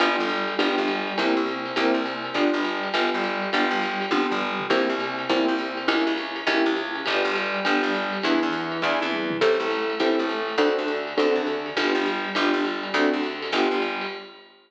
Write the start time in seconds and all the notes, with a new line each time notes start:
0.00 G1 B3 D4 F4 G4, kick, ride
0.18 G1 G3
0.29 hi-hat pedal, ride
0.48 ride
0.59 G1 B3 D4 F4 G4, kick, ride
0.78 G1 G3
0.88 hi-hat pedal, ride
1.07 ride
1.18 C2 A#3 C4 E4 G4, kick, ride
1.36 C2 C3
1.47 hi-hat pedal, ride
1.66 ride
1.76 C2 A#3 C4 E4 G4, kick, ride
1.94 C2 C3
2.06 hi-hat pedal, ride
2.24 ride
2.34 G1 B3 D4 F4 G4, kick, ride
2.53 G1 G3
2.65 hi-hat pedal, ride
2.83 ride
2.94 G1 B3 D4 F4 G4, kick, ride
3.13 G1 G3
3.24 hi-hat pedal, ride
3.42 ride
3.53 G1 B3 D4 F4 G4, kick, ride
3.70 G1 G3
3.82 hi-hat pedal, ride
4.01 ride
4.11 G1 B3 D4 F4 G4, kick, high tom
4.31 G1 G3, floor tom
4.60 floor tom
4.70 C2 A#3 C4 E4 G4, kick, crash, ride
4.89 C2 C3
5.00 hi-hat pedal, ride
5.19 ride
5.29 C2 A#3 C4 E4 G4, kick, ride
5.48 C2 C3
5.59 hi-hat pedal, ride
5.77 ride
5.88 C#2 A#3 C#4 E4 G4, kick, ride
6.07 C#2 C#3
6.18 hi-hat pedal, ride
6.36 ride
6.47 C#2 A#3 C#4 E4 G4, kick, ride
6.66 C#2 C#3
6.76 hi-hat pedal, ride
6.95 ride
7.06 G1 B3 D4 F4 G4, kick, ride
7.24 G1 G3
7.35 hi-hat pedal, ride
7.54 ride
7.65 G1 B3 D4 F4 G4, kick, ride
7.83 G1 G3
7.94 hi-hat pedal, ride
8.13 ride
8.23 E2 B3 D4 E4 G#4, ride
8.42 E2 E3, kick
8.53 hi-hat pedal, ride
8.72 ride
8.82 E2 B3 D4 E4 G#4, kick, snare
9.00 E2 E3, high tom
9.12 mid tom
9.30 floor tom
9.41 A1 C4 E4 G4 A4, kick, crash, ride
9.60 A1 A3
9.71 hi-hat pedal, ride
9.90 ride
10.00 A1 C4 E4 G4 A4, kick, ride
10.19 A1 A3
10.29 hi-hat pedal, ride
10.48 ride
10.58 D2 C4 D4 F#4 A4, kick, ride
10.78 D2 D3
10.88 hi-hat pedal, ride
11.07 ride
11.17 D2 C4 D4 F#4 A4, kick, ride
11.35 D2 D3
11.47 hi-hat pedal, ride
11.66 ride
11.77 G1 B3 D4 F4 G4, kick, ride
11.95 G1 G3
12.06 hi-hat pedal, ride
12.25 ride
12.35 G1 B3 D4 F4 G4, kick, ride
12.53 G1 G3
12.65 hi-hat pedal, ride
12.83 ride
12.94 D2 A3 C4 D4 F#4, kick, ride
13.12 D2 D3
13.23 hi-hat pedal, ride
13.42 ride
13.52 G1 B3 D4 F4 G4, kick, ride
13.71 G1 G3
13.82 hi-hat pedal, ride
14.01 ride